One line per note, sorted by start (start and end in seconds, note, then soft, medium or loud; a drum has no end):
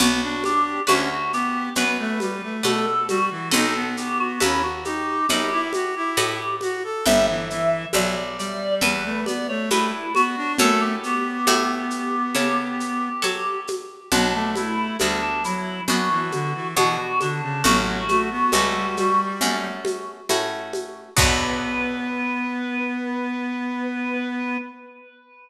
0.00 0.79 B1 loud
0.00 0.21 B3 loud
0.00 0.44 F#4 loud
0.00 0.79 B4 medium
0.00 0.79 D5 medium
0.00 0.79 F#5 medium
0.00 low conga medium
0.00 shaker medium
0.22 0.43 D4 medium
0.44 0.80 D4 medium
0.44 0.82 G4 loud
0.44 high conga medium
0.44 shaker medium
0.87 1.68 D2 medium
0.87 1.09 C#4 medium
0.87 1.08 F#4 loud
0.87 1.66 B4 medium
0.87 1.66 D5 medium
0.87 1.66 F#5 medium
0.87 high conga medium
0.87 shaker medium
1.11 1.32 F#4 loud
1.32 1.69 B3 medium
1.32 1.74 G4 loud
1.32 shaker medium
1.75 2.56 F#2 medium
1.75 1.98 B3 medium
1.75 2.57 B4 medium
1.75 2.57 D5 medium
1.75 2.57 F#5 medium
1.75 low conga medium
1.75 shaker medium
1.99 2.19 A3 loud
2.20 2.42 G3 medium
2.20 high conga medium
2.20 shaker medium
2.43 2.64 A3 medium
2.63 3.44 B2 medium
2.63 2.86 A3 medium
2.63 2.86 A4 loud
2.63 3.43 B4 medium
2.63 3.43 D5 medium
2.63 3.43 F#5 medium
2.63 high conga medium
2.63 shaker medium
2.86 3.07 A4 loud
3.09 3.30 G3 loud
3.09 3.48 F#4 loud
3.09 high conga medium
3.09 shaker medium
3.31 3.52 E3 medium
3.51 4.33 B1 loud
3.51 3.74 D#4 loud
3.51 4.31 A4 medium
3.51 3.88 A4 loud
3.51 4.31 B4 medium
3.51 4.31 D#5 medium
3.51 4.31 F#5 medium
3.51 low conga medium
3.51 shaker medium
3.75 3.96 B3 medium
3.97 4.40 B3 medium
3.97 4.18 G4 medium
3.97 shaker medium
4.20 4.41 F#4 loud
4.40 5.21 D#2 medium
4.40 4.62 C#4 medium
4.40 4.63 E4 loud
4.40 5.20 A4 medium
4.40 5.20 B4 medium
4.40 5.20 D#5 medium
4.40 5.20 F#5 medium
4.40 high conga medium
4.40 shaker medium
4.63 4.84 F#4 loud
4.85 5.26 D#4 medium
4.85 6.56 G4 loud
4.85 high conga medium
4.85 shaker medium
5.29 6.09 F#2 medium
5.29 5.50 D#4 medium
5.29 6.10 A4 medium
5.29 6.10 B4 medium
5.29 6.10 D#5 medium
5.29 6.10 F#5 medium
5.29 low conga medium
5.29 shaker medium
5.51 5.72 E4 medium
5.73 5.95 F#4 medium
5.73 high conga medium
5.73 shaker medium
5.96 6.17 E4 medium
6.17 6.97 A2 loud
6.17 6.39 E4 medium
6.17 6.97 A4 medium
6.17 6.97 B4 medium
6.17 6.97 D#5 medium
6.17 6.97 F#5 medium
6.17 high conga medium
6.17 shaker medium
6.61 6.83 F#4 medium
6.61 high conga medium
6.61 shaker medium
6.84 7.05 A4 medium
7.06 7.85 G1 medium
7.06 7.27 G3 loud
7.06 7.85 B4 medium
7.06 7.85 E5 medium
7.06 7.26 E5 loud
7.06 7.85 G5 loud
7.06 low conga medium
7.06 shaker medium
7.27 7.49 E3 medium
7.27 7.48 E5 loud
7.50 7.85 E3 loud
7.50 7.88 E5 loud
7.50 shaker medium
7.93 8.74 B1 loud
7.93 8.15 F#3 medium
7.93 8.73 B4 medium
7.93 8.15 D5 medium
7.93 8.73 E5 medium
7.93 8.73 G5 medium
7.93 high conga medium
7.93 shaker medium
8.17 8.38 D5 medium
8.38 8.81 G3 medium
8.38 8.74 D5 loud
8.38 shaker medium
8.81 9.61 E2 medium
8.81 9.03 G3 medium
8.81 9.61 B4 medium
8.81 9.20 B4 loud
8.81 9.61 E5 medium
8.81 9.61 G5 medium
8.81 low conga medium
8.81 shaker medium
9.04 9.25 A3 medium
9.26 9.47 B3 medium
9.26 9.47 D5 loud
9.26 high conga medium
9.26 shaker medium
9.49 9.69 A3 medium
9.49 9.69 C#5 loud
9.70 10.50 G2 medium
9.70 9.92 A3 medium
9.70 10.13 E4 loud
9.70 10.51 B4 medium
9.70 10.51 E5 medium
9.70 10.51 G5 medium
9.70 high conga medium
9.70 shaker medium
10.15 10.36 B3 medium
10.15 10.52 F#4 loud
10.15 high conga medium
10.15 shaker medium
10.37 10.58 D4 loud
10.58 11.39 F#2 loud
10.58 10.96 A3 loud
10.58 11.39 A4 medium
10.58 10.81 A4 loud
10.58 11.39 C#5 medium
10.58 11.39 F#5 medium
10.58 low conga loud
10.58 shaker medium
10.81 13.60 G4 medium
11.03 13.09 B3 medium
11.03 shaker medium
11.47 12.27 A2 loud
11.47 12.26 A4 medium
11.47 12.26 C#5 medium
11.47 12.26 F#5 medium
11.47 high conga medium
11.47 shaker medium
11.90 shaker medium
12.35 13.15 C#3 medium
12.35 13.14 A4 medium
12.35 13.14 C#5 medium
12.35 13.14 F#5 medium
12.35 low conga medium
12.35 shaker medium
12.80 shaker medium
13.22 14.03 F#3 medium
13.22 14.02 A4 medium
13.22 14.02 C#5 medium
13.22 14.02 F#5 medium
13.22 high conga medium
13.22 shaker medium
13.67 high conga medium
13.67 shaker medium
14.12 14.91 B1 medium
14.12 14.33 F#3 medium
14.12 14.91 B3 medium
14.12 14.91 D4 medium
14.12 14.49 D4 loud
14.12 14.91 F#4 medium
14.12 low conga medium
14.12 shaker medium
14.34 14.55 A3 medium
14.56 14.97 A3 medium
14.56 14.97 E4 loud
14.56 high conga medium
14.56 shaker medium
14.99 15.80 D2 medium
14.99 15.21 G3 medium
14.99 15.81 B3 medium
14.99 15.21 D4 medium
14.99 15.81 D4 medium
14.99 15.81 F#4 medium
14.99 high conga medium
14.99 shaker medium
15.22 15.43 D4 loud
15.44 15.81 F#3 medium
15.44 15.83 E4 medium
15.44 shaker medium
15.88 16.67 F#2 medium
15.88 16.09 F#3 medium
15.88 16.69 B3 medium
15.88 16.69 D4 medium
15.88 16.67 F#4 loud
15.88 16.69 F#4 medium
15.88 low conga medium
15.88 shaker medium
16.10 16.31 E3 medium
16.32 16.53 D3 medium
16.32 high conga medium
16.32 shaker medium
16.54 16.75 E3 medium
16.76 17.56 B2 loud
16.76 16.97 E3 medium
16.76 17.56 B3 medium
16.76 17.56 D4 medium
16.76 16.97 F#4 loud
16.76 17.56 F#4 medium
16.76 high conga medium
16.76 shaker medium
16.98 17.19 F#4 loud
17.20 17.41 D3 medium
17.20 17.62 D4 medium
17.20 high conga medium
17.20 shaker medium
17.42 17.63 C#3 medium
17.64 18.44 A1 loud
17.64 18.04 F#3 medium
17.64 18.43 A3 medium
17.64 18.43 C#4 medium
17.64 18.43 F#4 medium
17.64 19.21 F#4 loud
17.64 low conga medium
17.64 shaker medium
18.09 18.30 A3 medium
18.09 high conga medium
18.09 shaker medium
18.31 18.52 B3 medium
18.52 19.32 C#2 medium
18.52 18.74 G3 medium
18.52 19.34 A3 medium
18.52 19.34 C#4 medium
18.52 19.34 F#4 medium
18.52 high conga medium
18.52 shaker medium
18.75 18.96 G3 medium
18.97 19.68 G3 loud
18.97 high conga medium
18.97 shaker medium
19.41 20.20 F#2 medium
19.41 20.22 A3 medium
19.41 20.22 C#4 medium
19.41 20.22 F#4 medium
19.41 low conga medium
19.41 shaker medium
19.85 high conga medium
19.85 shaker medium
20.29 21.09 A2 medium
20.29 21.10 A3 medium
20.29 21.10 C#4 medium
20.29 21.10 F#4 medium
20.29 high conga medium
20.29 shaker medium
20.73 high conga medium
20.73 shaker medium
21.17 24.58 B1 loud
21.17 24.56 B3 loud
21.17 24.57 B3 loud
21.17 24.56 D4 loud
21.17 24.56 F#4 loud
21.17 24.58 B4 loud
21.17 kick loud
21.17 crash loud